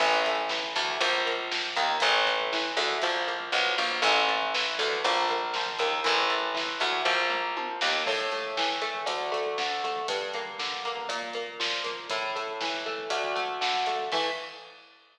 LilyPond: <<
  \new Staff \with { instrumentName = "Overdriven Guitar" } { \time 4/4 \key a \phrygian \tempo 4 = 119 e8 a8 e8 a8 f8 bes8 f8 bes8 | e8 a8 e8 a8 f8 bes8 f8 bes8 | e8 a8 e8 a8 f8 bes8 f8 bes8 | e8 a8 e8 a8 f8 bes8 f8 bes8 |
a,8 a8 e8 a8 d,8 a8 d8 a8 | g,8 bes8 d8 bes8 bes,8 bes8 f8 bes8 | a,8 a8 e8 a8 d,8 a8 d8 a8 | <e a>4 r2. | }
  \new Staff \with { instrumentName = "Electric Bass (finger)" } { \clef bass \time 4/4 \key a \phrygian a,,4. d,8 bes,,4. ees,8 | a,,4. d,8 bes,,4 b,,8 bes,,8 | a,,4. d,8 bes,,4. ees,8 | a,,4. d,8 bes,,4. ees,8 |
r1 | r1 | r1 | r1 | }
  \new DrumStaff \with { instrumentName = "Drums" } \drummode { \time 4/4 <cymc bd>16 bd16 <hh bd>16 bd16 <bd sn>16 bd16 <hh bd>16 bd16 <hh bd>16 bd16 <hh bd>16 bd16 <bd sn>16 bd16 <hh bd>16 bd16 | <hh bd>16 bd16 <hh bd>16 bd16 <bd sn>16 bd16 hh16 bd16 <hh bd>16 bd16 <hh bd>16 bd16 <bd sn>16 bd16 <hho bd>16 bd16 | <hh bd>16 bd16 <hh bd>16 bd16 <bd sn>16 bd16 <hh bd>16 bd16 <hh bd>16 bd16 <hh bd>16 bd16 <bd sn>16 bd16 <hh bd>16 bd16 | <hh bd>16 bd16 <hh bd>16 bd16 <bd sn>16 bd16 <hh bd>16 bd16 <bd tomfh>8 toml8 tommh8 sn8 |
<cymc bd>16 bd16 <hh bd>16 bd16 <bd sn>16 bd16 <hh bd>16 bd16 <hh bd>16 bd16 <hh bd>16 bd16 <bd sn>16 bd16 <hh bd>16 bd16 | <hh bd>16 bd16 <hh bd>16 bd16 <bd sn>16 bd16 <hh bd>16 bd16 <hh bd>16 bd16 <hh bd>16 bd16 <bd sn>16 bd16 <hh bd>16 bd16 | <hh bd>16 bd16 <hh bd>16 bd16 <bd sn>16 bd16 bd16 bd16 <hh bd>16 bd16 <hh bd>16 bd16 <bd sn>16 bd16 <hh bd>16 bd16 | <cymc bd>4 r4 r4 r4 | }
>>